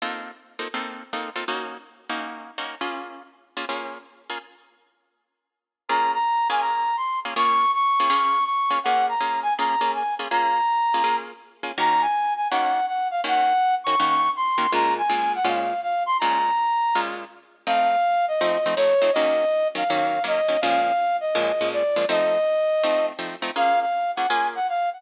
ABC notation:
X:1
M:4/4
L:1/8
Q:"Swing" 1/4=163
K:Bbm
V:1 name="Flute"
z8 | z8 | z8 | z8 |
b b2 a b2 c' z | d'2 d'4 d'2 | g b2 a b2 a z | b5 z3 |
b a2 a g2 g f | g3 d'3 c'2 | b a2 g f2 f c' | b5 z3 |
f3 e3 d2 | e3 f3 e2 | f3 e3 =d2 | e6 z2 |
f f2 g a g f g |]
V:2 name="Acoustic Guitar (steel)"
[B,CEF=A]3 [B,CEFA] [B,CEFA]2 [B,CEFA] [B,CEFA] | [B,DEG]3 [B,DEG]3 [B,DEG] [B,DFA]- | [B,DFA]3 [B,DFA] [B,DFA]3 [B,DFA] | z8 |
[B,DFA]3 [B,DFA]4 [B,DFA] | [B,DFA]3 [B,DFA] [B,DFA]3 [B,DFA] | [B,DFA]2 [B,DFA]2 [B,DFA] [B,DFA]2 [B,DFA] | [B,DFA]3 [B,DFA] [B,DFA]3 [B,DFA] |
[E,B,DG]4 [E,B,DG]4 | [E,B,DG]3 [E,B,DG] [E,B,DG]3 [E,B,DG] | [B,,A,DF]2 [B,,A,DF]2 [B,,A,DF]4 | [B,,A,DF]4 [B,,A,DF]4 |
[F,=A,CE]4 [F,A,CE] [F,A,CE] [F,A,CE] [F,A,CE] | [E,G,B,D]3 [E,G,B,D] [E,G,B,D]2 [E,G,B,D] [E,G,B,D] | [B,,F,A,D]4 [B,,F,A,D] [B,,F,A,D]2 [B,,F,A,D] | [F,=A,CE]4 [F,A,CE]2 [F,A,CE] [F,A,CE] |
[B,DFA]3 [B,DFA] [B,DFA]4 |]